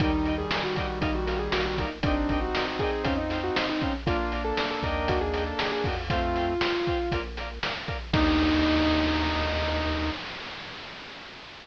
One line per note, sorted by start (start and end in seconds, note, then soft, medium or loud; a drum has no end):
0.00 0.45 D#2 medium
0.00 1.85 D#3 medium
0.00 1.85 G3 medium
0.00 0.34 D#4 medium
0.00 0.11 A#4 loud
0.00 0.11 D5 loud
0.00 0.11 D#5 loud
0.00 kick medium
0.00 closed hi-hat medium
0.04 0.11 G5 loud
0.25 0.35 A#4 medium
0.25 0.35 D5 medium
0.25 0.35 D#5 loud
0.25 0.35 G5 loud
0.25 closed hi-hat medium
0.38 0.63 G#4 medium
0.51 0.62 A#4 medium
0.51 0.62 D5 medium
0.51 0.62 D#5 medium
0.51 snare loud
0.56 0.62 G5 medium
0.64 0.75 F#4 medium
0.76 0.98 F#4 medium
0.76 0.86 A#4 medium
0.76 0.86 D5 loud
0.76 0.86 D#5 medium
0.76 0.86 G5 medium
0.76 kick medium
0.76 closed hi-hat medium
1.01 1.49 A#1 medium
1.01 1.14 D#4 medium
1.01 1.11 A#4 loud
1.01 1.11 D#5 loud
1.01 1.11 F5 loud
1.01 kick medium
1.01 closed hi-hat medium
1.15 1.39 F#4 medium
1.26 1.36 A#4 medium
1.26 1.36 D#5 medium
1.26 1.36 F5 medium
1.26 snare soft
1.26 closed hi-hat medium
1.39 1.51 G#4 medium
1.51 2.00 A#1 medium
1.51 1.65 F#4 medium
1.51 1.61 A#4 loud
1.51 1.61 D5 loud
1.51 1.61 F5 loud
1.51 snare medium
1.66 1.78 F#4 medium
1.78 1.91 D#4 medium
1.78 1.89 A#4 medium
1.78 1.89 D5 medium
1.78 1.89 F5 medium
1.78 kick medium
1.78 closed hi-hat medium
2.03 2.50 G1 medium
2.03 3.93 C4 medium
2.03 2.37 D4 medium
2.03 3.93 D#4 medium
2.03 2.14 A#4 medium
2.03 2.14 D5 medium
2.03 2.14 D#5 loud
2.03 kick medium
2.03 closed hi-hat medium
2.07 2.14 G5 loud
2.29 2.39 A#4 medium
2.29 2.39 D5 medium
2.29 2.39 D#5 medium
2.29 2.39 G5 loud
2.29 kick medium
2.29 closed hi-hat medium
2.41 2.62 F#4 medium
2.55 2.65 A#4 medium
2.55 2.65 D5 medium
2.55 2.65 D#5 medium
2.55 2.65 G5 medium
2.55 snare medium
2.67 2.80 F#4 medium
2.79 3.02 G#4 medium
2.79 2.90 A#4 loud
2.79 2.90 D5 medium
2.79 2.90 D#5 loud
2.79 kick medium
2.79 closed hi-hat medium
2.84 2.90 G5 medium
3.03 3.51 F2 medium
3.03 3.17 C#4 medium
3.03 3.13 C5 loud
3.03 3.13 F5 loud
3.03 3.13 G5 loud
3.03 kick medium
3.03 closed hi-hat medium
3.17 3.38 D#4 medium
3.30 3.41 C5 medium
3.30 3.41 F5 medium
3.30 3.41 G5 medium
3.30 snare medium
3.30 closed hi-hat medium
3.44 3.56 F#4 medium
3.55 3.67 D#4 medium
3.55 3.66 C5 medium
3.55 3.66 F5 medium
3.55 3.66 G5 loud
3.55 snare loud
3.69 3.82 D#4 medium
3.81 3.94 C#4 medium
3.81 3.91 C5 medium
3.81 3.91 F5 medium
3.81 3.91 G5 medium
3.81 kick medium
3.81 closed hi-hat medium
4.06 4.53 A#1 medium
4.06 5.89 A#3 medium
4.06 5.89 D4 medium
4.06 4.43 F4 medium
4.06 4.16 A#4 loud
4.06 4.16 D5 loud
4.06 4.16 F5 loud
4.06 kick medium
4.06 closed hi-hat medium
4.32 4.42 A#4 medium
4.32 4.42 D5 medium
4.32 4.42 F5 medium
4.32 closed hi-hat medium
4.45 4.66 A4 medium
4.57 4.68 A#4 medium
4.57 4.68 D5 medium
4.57 4.68 F5 loud
4.57 snare medium
4.71 4.83 A4 medium
4.83 5.54 D#2 medium
4.83 5.19 A#4 loud
4.83 5.06 A#4 medium
4.83 5.19 D5 loud
4.83 5.19 D#5 loud
4.83 kick medium
4.83 closed hi-hat medium
4.87 5.19 G5 medium
5.08 5.21 F#4 medium
5.08 kick medium
5.08 closed hi-hat medium
5.21 5.42 G#4 medium
5.33 5.43 A#4 medium
5.33 5.43 D5 medium
5.33 5.43 D#5 medium
5.33 5.43 G5 loud
5.33 snare soft
5.33 closed hi-hat medium
5.46 5.58 A4 medium
5.57 5.72 G#4 medium
5.57 5.68 A#4 medium
5.57 5.68 D5 medium
5.57 5.68 D#5 medium
5.57 5.68 G5 medium
5.57 snare medium
5.72 5.84 G#4 medium
5.84 6.57 F2 medium
5.84 5.97 F#4 medium
5.84 5.95 A#4 medium
5.84 5.95 D5 medium
5.84 5.95 D#5 medium
5.84 kick medium
5.84 open hi-hat medium
5.89 5.95 G5 medium
6.09 6.54 A3 medium
6.09 6.54 C4 medium
6.09 7.20 F4 medium
6.09 6.20 C5 loud
6.09 6.20 F5 loud
6.09 6.20 G5 loud
6.09 kick medium
6.09 closed hi-hat medium
6.36 6.46 C5 medium
6.36 6.46 F5 medium
6.36 6.46 G5 loud
6.36 closed hi-hat medium
6.61 6.72 C5 medium
6.61 6.72 F5 medium
6.61 6.72 G5 medium
6.61 snare loud
6.87 6.98 C5 medium
6.87 6.98 F5 medium
6.87 6.98 G5 medium
6.87 kick medium
6.87 closed hi-hat medium
7.12 7.59 A#1 medium
7.12 7.22 A#4 medium
7.12 7.22 D5 medium
7.12 7.22 F5 loud
7.12 kick medium
7.12 closed hi-hat medium
7.37 7.49 A#4 medium
7.37 7.49 D5 medium
7.37 7.49 F5 medium
7.37 snare soft
7.37 closed hi-hat medium
7.63 7.73 A#4 medium
7.63 7.73 D5 medium
7.63 7.73 F5 medium
7.63 snare medium
7.87 7.97 A#4 medium
7.87 7.97 D5 medium
7.87 7.97 F5 medium
7.87 kick medium
7.87 closed hi-hat medium
8.13 10.11 D#2 loud
8.13 10.10 A#3 medium
8.13 10.10 D4 loud
8.13 10.10 D#4 loud
8.13 kick loud
8.13 crash loud
8.18 10.10 G4 medium